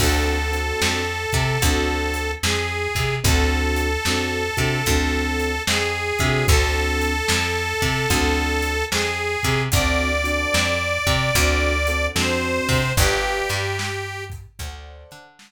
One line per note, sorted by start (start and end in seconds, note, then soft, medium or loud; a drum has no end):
0.00 0.72 D2 loud
0.00 0.36 C4 medium
0.00 0.36 D4 loud
0.00 0.36 F#4 loud
0.00 0.36 A4 loud
0.00 2.31 A4 medium
0.00 kick medium
0.00 crash medium
0.51 1.01 C4 medium
0.51 1.01 D4 medium
0.51 1.01 F#4 medium
0.51 1.01 A4 medium
0.51 closed hi-hat medium
0.82 1.26 F2 medium
0.82 snare loud
1.32 1.58 C3 loud
1.32 kick medium
1.32 closed hi-hat medium
1.62 2.35 D2 loud
1.62 2.27 C4 loud
1.62 2.27 D4 medium
1.62 2.27 F#4 loud
1.62 2.27 A4 loud
1.62 kick medium
1.62 closed hi-hat loud
2.14 closed hi-hat medium
2.43 2.88 F2 medium
2.43 3.15 G#4 medium
2.43 snare loud
2.95 3.20 C3 medium
2.95 kick medium
2.95 closed hi-hat medium
3.24 3.97 D2 loud
3.24 3.88 C4 loud
3.24 3.88 D4 loud
3.24 3.88 F#4 loud
3.24 3.88 A4 medium
3.24 5.62 A4 medium
3.24 kick loud
3.24 closed hi-hat loud
3.76 closed hi-hat medium
4.05 4.50 F2 medium
4.05 4.43 C4 medium
4.05 4.43 D4 medium
4.05 4.43 F#4 medium
4.05 4.43 A4 medium
4.05 snare medium
4.57 4.82 C3 medium
4.57 4.77 C4 medium
4.57 4.77 D4 medium
4.57 4.77 F#4 medium
4.57 4.77 A4 medium
4.57 kick medium
4.57 closed hi-hat medium
4.86 5.59 D2 medium
4.86 5.52 C4 medium
4.86 5.52 D4 medium
4.86 5.52 F#4 medium
4.86 5.52 A4 loud
4.86 kick medium
4.86 closed hi-hat medium
5.40 closed hi-hat medium
5.67 6.12 F2 medium
5.67 6.46 G#4 medium
5.67 snare loud
6.19 6.44 C3 medium
6.19 7.12 C4 loud
6.19 7.12 D4 loud
6.19 7.12 F#4 loud
6.19 7.12 A4 loud
6.19 kick medium
6.19 closed hi-hat medium
6.48 7.21 D2 loud
6.48 8.85 A4 loud
6.48 kick loud
6.48 closed hi-hat medium
7.01 closed hi-hat medium
7.28 7.74 F2 medium
7.28 snare loud
7.82 8.06 C3 medium
7.82 kick medium
7.82 closed hi-hat medium
8.10 8.83 D2 medium
8.10 8.74 C4 medium
8.10 8.74 D4 medium
8.10 8.74 F#4 medium
8.10 8.74 A4 loud
8.10 kick medium
8.10 closed hi-hat medium
8.62 closed hi-hat medium
8.91 9.37 F2 medium
8.91 9.62 G#4 medium
8.91 snare loud
9.43 9.69 C3 medium
9.43 kick medium
9.43 closed hi-hat medium
9.72 10.45 D2 loud
9.72 10.09 C4 medium
9.72 10.09 D4 loud
9.72 10.09 F#4 loud
9.72 10.09 A4 loud
9.72 12.06 D5 medium
9.72 kick loud
9.72 closed hi-hat loud
10.24 10.73 C4 medium
10.24 10.73 D4 loud
10.24 10.73 F#4 medium
10.24 10.73 A4 medium
10.24 closed hi-hat medium
10.54 10.99 F2 medium
10.54 snare medium
11.07 11.31 C3 medium
11.07 kick medium
11.07 closed hi-hat medium
11.35 12.08 D2 loud
11.35 11.73 C4 loud
11.35 11.73 D4 loud
11.35 11.73 F#4 loud
11.35 11.73 A4 loud
11.35 kick medium
11.35 closed hi-hat loud
11.87 12.08 C4 medium
11.87 12.08 D4 medium
11.87 12.08 F#4 medium
11.87 12.08 A4 medium
11.87 closed hi-hat medium
12.15 12.60 F2 medium
12.15 12.79 C4 medium
12.15 12.79 D4 medium
12.15 12.79 F#4 medium
12.15 12.79 A4 medium
12.15 12.92 C5 medium
12.15 snare medium
12.69 12.93 C3 medium
12.69 kick medium
12.69 open hi-hat medium
12.97 13.42 G1 loud
12.97 14.24 G4 loud
12.97 13.61 B4 loud
12.97 13.61 D5 loud
12.97 13.61 F5 medium
12.97 13.61 G5 medium
12.97 kick loud
12.97 closed hi-hat loud
13.49 14.47 G2 medium
13.49 closed hi-hat medium
13.79 snare loud
14.30 kick medium
14.30 closed hi-hat medium
14.59 15.04 D2 loud
14.59 15.24 A4 loud
14.59 15.24 C5 medium
14.59 15.24 D5 loud
14.59 15.24 F#5 loud
14.59 kick medium
14.59 closed hi-hat medium
15.11 15.52 D3 loud
15.11 closed hi-hat medium
15.39 snare loud